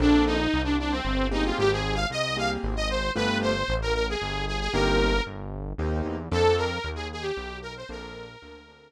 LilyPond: <<
  \new Staff \with { instrumentName = "Lead 2 (sawtooth)" } { \time 3/4 \key bes \mixolydian \tempo 4 = 114 d'8 ees'8. d'16 d'16 c'8. ees'16 f'16 | g'16 aes'8 f''16 ees''8 f''16 r8 ees''16 c''8 | b'8 c''8. bes'16 bes'16 aes'8. aes'16 aes'16 | bes'4 r2 |
a'8 bes'8. aes'16 aes'16 g'8. bes'16 c''16 | bes'2 r4 | }
  \new Staff \with { instrumentName = "Acoustic Grand Piano" } { \time 3/4 \key bes \mixolydian <bes c' d' a'>2~ <bes c' d' a'>8 <bes c' g' aes'>8~ | <bes c' g' aes'>4. <bes c' g' aes'>4. | <a b f' g'>2. | <bes c' ees' g'>2 <bes c' ees' g'>4 |
<bes c' d' a'>2. | <bes c' d' a'>4 <bes c' d' a'>8 <bes c' d' a'>4. | }
  \new Staff \with { instrumentName = "Synth Bass 1" } { \clef bass \time 3/4 \key bes \mixolydian bes,,4 c,4 g,,4 | aes,,4 c,4 aes,,4 | g,,4 a,,4 g,,4 | g,,4 g,,4 ees,8 e,8 |
f,4 ees,4 b,,4 | bes,,4 d,4 r4 | }
>>